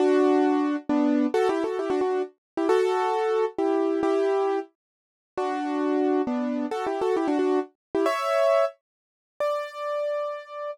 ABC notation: X:1
M:3/4
L:1/16
Q:1/4=134
K:D
V:1 name="Acoustic Grand Piano"
[DF]8 [B,D]4 | (3[FA]2 [EG]2 [FA]2 [EG] [DF] [DF]2 z3 [EG] | [FA]8 [EG]4 | [EG]6 z6 |
[DF]8 [B,D]4 | (3[FA]2 [EG]2 [FA]2 [EG] [DF] [DF]2 z3 [EG] | [ce]6 z6 | d12 |]